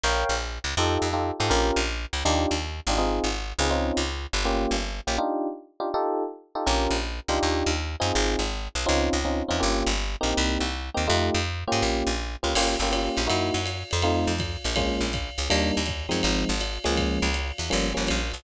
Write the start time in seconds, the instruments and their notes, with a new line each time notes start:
0.03 electric bass (finger) A#1, electric piano 1 A#4 C#5 F5 G5
0.29 electric bass (finger) A#1
0.64 electric bass (finger) C#2
0.77 electric bass (finger) F2, electric piano 1 D#4 F4 G4 A4
1.02 electric bass (finger) F2
1.13 electric piano 1 D#4 F4 G4 A4
1.40 electric bass (finger) G#2, electric piano 1 D#4 F4 G4 A4
1.50 electric bass (finger) A#1, electric piano 1 C#4 F4 G4 A#4
1.76 electric bass (finger) A#1
2.13 electric bass (finger) C#2
2.25 electric bass (finger) D#2, electric piano 1 D4 D#4 F4 G4
2.51 electric bass (finger) D#2
2.87 electric bass (finger) G#1, electric piano 1 D4 D#4 F4 G4
2.98 electric piano 1 C4 D#4 F4 G#4
3.24 electric bass (finger) G#1
3.59 electric bass (finger) C#2, electric piano 1 C4 D#4 F4 G#4
3.70 electric piano 1 C4 C#4 D#4 F4
3.97 electric bass (finger) C#2
4.33 electric bass (finger) G1
4.45 electric piano 1 A#3 C#4 F4 G4
4.71 electric bass (finger) G1
5.07 electric bass (finger) A#1, electric piano 1 A#3 C#4 F4 G4
5.18 electric piano 1 D4 D#4 F4 G4
5.80 electric piano 1 D4 D#4 F4 G4
5.94 electric piano 1 D#4 F4 G4 A4
6.55 electric piano 1 D#4 F4 G4 A4
6.66 electric bass (finger) A#1, electric piano 1 C#4 F4 G4 A#4
6.90 electric bass (finger) A#1
7.28 electric bass (finger) C#2, electric piano 1 D4 D#4 F4 G4
7.43 electric bass (finger) D#2
7.66 electric bass (finger) D#2
8.00 electric bass (finger) F#2, electric piano 1 C4 D#4 F4 G#4
8.15 electric bass (finger) G#1
8.39 electric bass (finger) G#1
8.75 electric bass (finger) B1
8.86 electric bass (finger) C#2, electric piano 1 C4 C#4 D#4 F4
9.13 electric bass (finger) C#2
9.25 electric piano 1 C4 C#4 D#4 F4
9.48 electric bass (finger) E2, electric piano 1 C4 C#4 D#4 F4
9.60 electric bass (finger) G1, electric piano 1 A#3 C#4 F4 G4
9.86 electric bass (finger) G1
10.21 electric bass (finger) A#1, electric piano 1 A#3 C4 D#4 G4
10.37 electric bass (finger) C2
10.60 electric bass (finger) C2
10.94 electric bass (finger) D#2, electric piano 1 A#3 C4 D#4 G4
11.08 electric bass (finger) F2, electric piano 1 A3 D#4 F4 G4
11.34 electric bass (finger) F2
11.67 electric piano 1 A#3 C#4 F4 G4
11.72 electric bass (finger) G#2
11.82 electric bass (finger) A#1
12.07 electric bass (finger) A#1
12.43 electric bass (finger) C#2, electric piano 1 A#3 C#4 F4 G4
12.55 electric bass (finger) G1, electric piano 1 A#3 C#4 F4 G4, crash, ride
12.80 electric bass (finger) G1, electric piano 1 A#3 C#4 F4 G4
12.92 electric piano 1 A#3 C#4 F4 G4, hi-hat pedal, ride
13.17 electric bass (finger) A#1, ride
13.27 electric bass (finger) F#2, electric piano 1 A#3 D#4 E4 F#4, ride
13.54 electric bass (finger) F#2
13.66 hi-hat pedal, ride
13.91 electric bass (finger) F2, ride
14.02 electric piano 1 A3 C4 D#4 F4, ride
14.27 electric bass (finger) F2
14.38 kick, hi-hat pedal, ride
14.64 electric bass (finger) A#1, ride
14.76 electric piano 1 G#3 A#3 C#4 F4, kick, ride
15.01 electric bass (finger) A#1
15.13 kick, hi-hat pedal, ride
15.38 electric bass (finger) C#2, ride
15.50 electric bass (finger) D#2, electric piano 1 G3 A#3 D4 D#4, ride
15.77 electric bass (finger) D#2
15.86 kick, hi-hat pedal, ride
16.09 electric bass (finger) F#2, electric piano 1 F3 G#3 C4 D#4, ride
16.23 electric bass (finger) G#1, ride
16.49 electric bass (finger) G#1
16.61 hi-hat pedal, ride
16.84 electric bass (finger) C#2, electric piano 1 F3 G#3 A#3 C#4, ride
16.97 kick, ride
17.22 electric bass (finger) C#2
17.34 hi-hat pedal, ride
17.58 electric bass (finger) E2, ride
17.70 electric bass (finger) G1, electric piano 1 F3 G3 A#3 C#4, ride
17.94 electric bass (finger) G1, electric piano 1 F3 G3 A#3 C#4
18.07 electric bass (finger) A#1, hi-hat pedal, ride
18.32 electric bass (finger) B1, ride